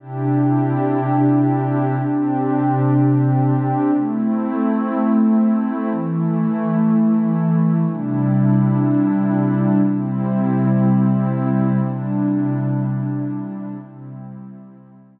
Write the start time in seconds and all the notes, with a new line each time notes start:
0.00 C3 D4 E4 G4
1.97 C3 C4 D4 G4
3.93 A3 C4 E4
5.90 E3 A3 E4
7.87 C3 G3 D4 E4
9.84 C3 G3 C4 E4
11.80 C3 G3 D4 E4
13.77 C3 G3 C4 E4